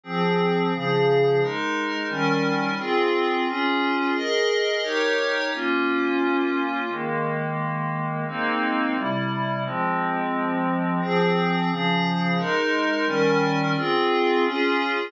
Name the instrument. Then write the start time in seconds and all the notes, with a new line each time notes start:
pad 5 (bowed)
0.03 F3 C4 G#4
0.73 C#3 F3 G#4
1.41 G#3 D#4 A#4
2.09 D#3 G3 C#4 A#4
2.78 C4 F4 G#4
3.47 C#4 F4 G#4
4.15 G#4 A#4 D#5
4.83 D#4 G4 A#4 C#5
5.53 A#3 C#4 F4
6.89 D#3 G#3 A#3
8.27 G#3 A#3 C4 D#4
8.95 C3 G3 E4
9.64 F3 G#3 C4
11.01 F3 C4 G#4
11.69 C#3 F3 G#4
12.38 G#3 D#4 A#4
13.06 D#3 G3 C#4 A#4
13.76 C4 F4 G#4
14.43 C#4 F4 G#4